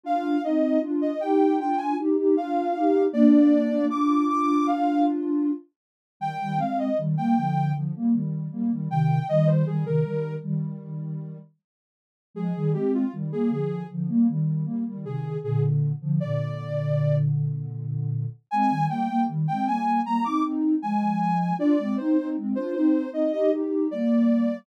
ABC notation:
X:1
M:4/4
L:1/16
Q:1/4=78
K:Eb
V:1 name="Ocarina"
f2 e2 z e g2 g a z2 f4 | d4 d'2 d'2 f2 z6 | g2 f e z g g2 z6 g2 | e c A B3 z10 |
A2 G F z A A2 z6 A2 | A z3 d6 z6 | a2 g2 z g a2 b d' z2 a4 | d2 c2 z c c2 e e z2 d4 |]
V:2 name="Ocarina"
[DF]2 [CE]2 [DF]2 [EG]2 [DF]2 [EG] [EG] [DF]2 [EG]2 | [B,D]4 [DF]10 z2 | [E,G,] [E,G,] [A,C]2 [E,G,] [G,B,] [D,F,]2 [D,F,] [G,B,] [E,G,]2 [G,B,] [E,G,] [C,E,]2 | [E,G,]2 [E,G,] [C,E,] [E,G,]2 [E,G,]6 z4 |
[F,A,] [E,G,] [A,C]2 [E,G,] [G,B,] [D,F,]2 [D,F,] [G,B,] [E,G,]2 [G,B,] [E,G,] [C,E,]2 | [B,,D,]3 [D,F,] [B,,D,]12 | [A,C] [E,G,] [G,B,] [G,B,] [E,G,] [A,C] [G,B,]2 [G,B,] [CE] [CE]2 [F,A,]4 | [DF] [A,C] [CE] [CE] [A,C] [DF] [CE]2 [CE] [EG] [EG]2 [G,B,]4 |]